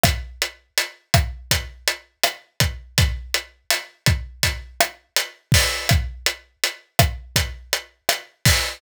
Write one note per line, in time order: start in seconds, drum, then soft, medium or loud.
0.04 kick medium
0.04 cross-stick medium
0.04 closed hi-hat loud
0.42 closed hi-hat medium
0.78 closed hi-hat loud
1.14 kick medium
1.14 cross-stick medium
1.14 closed hi-hat medium
1.51 kick medium
1.51 closed hi-hat loud
1.88 closed hi-hat medium
2.23 cross-stick medium
2.23 closed hi-hat medium
2.60 kick medium
2.60 closed hi-hat medium
2.98 kick loud
2.98 closed hi-hat loud
3.34 closed hi-hat medium
3.70 cross-stick medium
3.70 closed hi-hat loud
4.06 kick medium
4.06 closed hi-hat medium
4.43 kick medium
4.43 closed hi-hat loud
4.80 cross-stick medium
4.80 closed hi-hat medium
5.16 closed hi-hat loud
5.52 kick medium
5.52 open hi-hat medium
5.89 kick medium
5.89 cross-stick medium
5.89 closed hi-hat medium
6.26 closed hi-hat medium
6.64 closed hi-hat medium
6.99 kick medium
6.99 cross-stick medium
6.99 closed hi-hat medium
7.36 kick medium
7.36 closed hi-hat loud
7.73 closed hi-hat medium
8.09 cross-stick medium
8.09 closed hi-hat loud
8.45 kick medium
8.45 open hi-hat medium